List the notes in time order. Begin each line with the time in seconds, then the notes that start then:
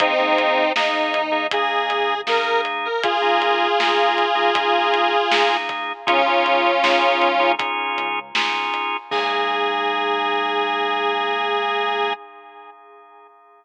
0.00 G#1 A#3 C4 D#4 G#4, kick, closed hi-hat
0.19 D#2 A#3 D#4 G#4
0.38 G#1, closed hi-hat
0.76 A#3 D#4 G#4, snare
1.14 D#2, closed hi-hat
1.32 A#3 D#4 G#4
1.51 A#3 D#4 G#4, kick, closed hi-hat
1.90 G#1, closed hi-hat
2.27 G#1 A#3 D#4 G#4 A#4, snare
2.65 closed hi-hat
2.85 A#4
3.03 F4 G#4, kick, closed hi-hat
3.22 A#3 D#4 G#4
3.42 closed hi-hat
3.80 A#3 D#4 G#4, snare
4.18 closed hi-hat
4.35 A#3 D#4 G#4
4.55 A#3 D#4 G#4, kick, closed hi-hat
4.94 closed hi-hat
5.31 A#3 D#4 G#4, snare
5.69 kick, closed hi-hat
6.07 C#2 C#4 D#4 F4 G#4, kick, closed hi-hat
6.26 C#3 C#4 D#4 F4 G#4
6.46 C#2, closed hi-hat
6.84 C#4 D#4 F4 G#4, snare
7.22 G#2, closed hi-hat
7.40 C#4 D#4 F4 G#4
7.59 C#4 D#4 F4 G#4, kick, closed hi-hat
7.97 C#2, closed hi-hat
8.35 C#2 C#4 D#4 F4 G#4, snare
8.74 closed hi-hat
9.11 G#2 A#3 D#4 G#4, kick, crash